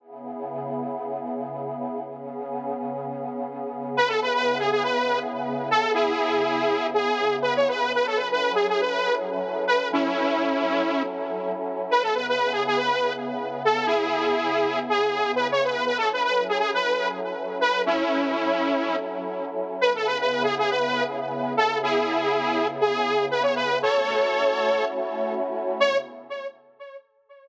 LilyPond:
<<
  \new Staff \with { instrumentName = "Lead 2 (sawtooth)" } { \time 4/4 \key cis \minor \tempo 4 = 121 r1 | r1 | b'16 a'16 b'16 b'8 gis'16 gis'16 b'8. r4 a'8 | <e' gis'>2 gis'4 b'16 cis''16 b'8 |
b'16 a'16 b'16 b'8 gis'16 gis'16 b'8. r4 b'8 | <cis' e'>2~ <cis' e'>8 r4. | b'16 a'16 b'16 b'8 gis'16 gis'16 b'8. r4 a'8 | <e' gis'>2 gis'4 b'16 cis''16 b'8 |
b'16 a'16 b'16 b'8 gis'16 gis'16 b'8. r4 b'8 | <cis' e'>2~ <cis' e'>8 r4. | b'16 a'16 b'16 b'8 gis'16 gis'16 b'8. r4 a'8 | <e' gis'>2 gis'4 b'16 cis''16 b'8 |
<a' cis''>2~ <a' cis''>8 r4. | cis''4 r2. | }
  \new Staff \with { instrumentName = "Pad 5 (bowed)" } { \time 4/4 \key cis \minor <cis b e' gis'>1 | <cis b cis' gis'>1 | <cis b e' gis'>1~ | <cis b e' gis'>1 |
<fis cis' e' a'>1~ | <fis cis' e' a'>1 | <cis b e' gis'>1~ | <cis b e' gis'>1 |
<fis cis' e' a'>1~ | <fis cis' e' a'>1 | <cis b e' gis'>1~ | <cis b e' gis'>1 |
<a cis' e' fis'>1 | <cis b e' gis'>4 r2. | }
>>